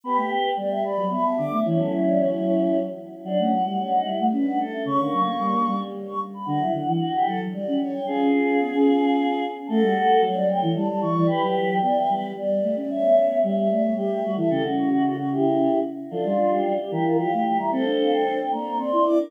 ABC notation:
X:1
M:3/4
L:1/16
Q:1/4=112
K:D
V:1 name="Choir Aahs"
b g g2 g2 b2 b a d'2 | c A c d c6 z2 | [K:Bm] f8 z f z e | c'8 z c' z b |
f8 z f z g | ^G2 G G7 z2 | [K:D] a f f2 f2 g2 a a c'2 | b g7 z4 |
e6 d c G2 F A | G z F F F F G4 z2 | [K:Dm] A F F G2 G B2 f2 g b | a f f g2 g b2 c'2 d' d' |]
V:2 name="Choir Aahs"
[GB]4 d e d2 e3 e | [CE]10 z2 | [K:Bm] D C z2 C ^D E z B2 A2 | C ^A,5 z6 |
F E z2 F G A z d2 c2 | [^E^G]12 | [K:D] [FA]4 c d c2 d3 d | [GB]4 d e B2 d3 d |
[ce]4 e e e2 e3 e | A F2 F F F E4 z2 | [K:Dm] [DF]6 G F G G G E | [Ac]6 d c d d d B |]
V:3 name="Choir Aahs"
B, A, z2 G,3 F, B, B, D, A, | E, F,9 z2 | [K:Bm] F, A, F, G, z2 G, A, C D z2 | C, D, F, ^A, G, A, G,4 z2 |
D, F, D, E, z2 F, F, G, C z2 | C2 C2 B, C5 z2 | [K:D] A, G, z2 F,3 E, G, G, E, E, | z F,3 B,2 G,2 G,2 A, C |
z B,3 G,2 A,2 G,2 G, E, | C, C,9 z2 | [K:Dm] F, G, G,2 G, z E,2 F, A,2 G, | C D D2 D z B,2 C E2 D |]